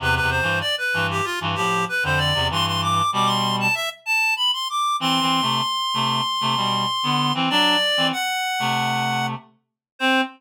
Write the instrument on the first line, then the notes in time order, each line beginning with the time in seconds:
clarinet
0.00 E2 C3 B4
0.15 B4
0.21 E2 C3
0.30 C5
0.42 G2 E3
0.61 D5
0.78 B4
0.94 G2 E3
1.11 G4
1.25 F4
1.41 G2 E3
1.55 A2 F3 G4
1.89 B4
2.03 F2 D3 C5
2.18 D5
2.34 E2 C3
2.50 G2 E3 C6
2.66 C6
2.82 D6
3.12 B2 G3 D6
3.26 C6
3.60 A5
3.75 E5
4.06 A5
4.36 B5
4.53 C6
4.70 D6
5.00 E3 C4 C6
5.21 E3 C4
5.42 C3 A3
5.94 C3 A3
6.41 C3 A3
6.56 B2 G3
7.03 D3 B3
7.34 E3 C4
7.50 F#3 D4 D5
7.97 E3 C4
8.12 F#5
8.59 C3 A3
9.99 C4 C5